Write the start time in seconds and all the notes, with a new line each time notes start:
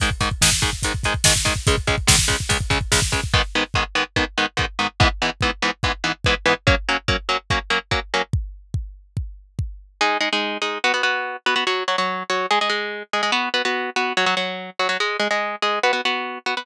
0.00 G#2 D#3 G#3, kick, closed hi-hat
0.11 kick
0.20 G#2 D#3 G#3, kick, closed hi-hat
0.31 kick
0.41 G#2 D#3 G#3, kick, snare
0.52 kick
0.62 G#2 D#3 G#3, kick, closed hi-hat
0.73 kick
0.83 G#2 D#3 G#3, kick, closed hi-hat
0.94 kick
1.03 G#2 D#3 G#3, kick, closed hi-hat
1.14 kick
1.24 G#2 D#3 G#3, kick, snare
1.36 kick
1.45 G#2 D#3 G#3, kick, closed hi-hat
1.56 kick
1.67 C#2 C#3 G#3, kick, closed hi-hat
1.78 kick
1.87 C#2 C#3 G#3, kick, closed hi-hat
1.98 kick
2.07 C#2 C#3 G#3, kick, snare
2.19 kick
2.28 C#2 C#3 G#3, kick, closed hi-hat
2.40 kick
2.49 C#2 C#3 G#3, kick, closed hi-hat
2.61 kick
2.70 C#2 C#3 G#3, kick, closed hi-hat
2.81 kick
2.92 C#2 C#3 G#3, kick, snare
3.02 kick
3.12 C#2 C#3 G#3, kick, closed hi-hat
3.24 kick
3.34 G#2 D#3 B3, kick
3.55 G#2 D#3 B3
3.74 G#2 D#3 B3, kick
3.95 G#2 D#3 B3
4.16 G#2 D#3 B3, kick
4.38 G#2 D#3 B3
4.57 G#2 D#3 B3, kick
4.79 G#2 D#3 B3
5.00 G#2 E3 B3, kick
5.22 G#2 E3 B3
5.41 G#2 E3 B3, kick
5.62 G#2 E3 B3
5.83 G#2 E3 B3, kick
6.04 G#2 E3 B3
6.24 G#2 E3 B3, kick
6.46 G#2 E3 B3
6.67 F#3 A#3 C#4, kick
6.89 F#3 A#3 C#4
7.08 F#3 A#3 C#4, kick
7.29 F#3 A#3 C#4
7.50 F#3 A#3 C#4, kick
7.70 F#3 A#3 C#4
7.91 F#3 A#3 C#4, kick
8.14 F#3 A#3 C#4
8.33 kick
8.74 kick
9.17 kick
9.59 kick
10.01 G#3 D#4 G#4
10.20 G#3 D#4 G#4
10.33 G#3 D#4 G#4
10.62 G#3 D#4 G#4
10.84 B3 F#4 B4
10.94 B3 F#4 B4
11.03 B3 F#4 B4
11.46 B3 F#4 B4
11.56 B3 F#4 B4
11.67 F#3 F#4 C#5
11.88 F#3 F#4 C#5
11.98 F#3 F#4 C#5
12.30 F#3 F#4 C#5
12.51 G#3 G#4 D#5
12.61 G#3 G#4 D#5
12.70 G#3 G#4 D#5
13.13 G#3 G#4 D#5
13.23 G#3 G#4 D#5
13.32 B3 F#4 B4
13.54 B3 F#4 B4
13.65 B3 F#4 B4
13.96 B3 F#4 B4
14.17 F#3 F#4 C#5
14.26 F#3 F#4 C#5
14.37 F#3 F#4 C#5
14.79 F#3 F#4 C#5
14.89 F#3 F#4 C#5
15.00 G#3 G#4 D#5
15.20 G#3 G#4 D#5
15.31 G#3 G#4 D#5
15.62 G#3 G#4 D#5
15.83 B3 F#4 B4
15.93 B3 F#4 B4
16.05 B3 F#4 B4
16.46 B3 F#4 B4
16.57 B3 F#4 B4